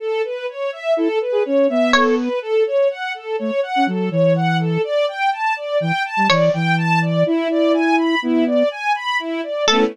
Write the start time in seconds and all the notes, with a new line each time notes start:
0.00 A4
0.24 B4
0.49 C#5
0.72 E5
0.97 E4 A4
1.21 B4
1.32 G#4
1.45 C#4 C#5
1.69 B3 E5
1.93 A4 C#5
2.18 B4
2.42 A4
2.66 C#5
2.90 F#5
3.14 A4
3.39 A3 C#5
3.63 F#5
3.76 C#4
3.87 F#3 A4
4.11 E3 C#5
4.35 F#5
4.60 A4
4.84 D5
5.08 G5
5.32 A5
5.56 D5
5.80 E3 G5
6.05 A5
6.17 G3
6.29 E3 C#5 D5
6.53 E3 G5
6.77 A5
7.02 D5
7.26 E4
7.50 D5
7.74 G#5
7.98 B5
8.22 B3 E4
8.47 D5
8.71 G#5
8.95 B5
9.19 E4
9.43 D5
9.67 A3 B3 A4
9.73 C#4 E4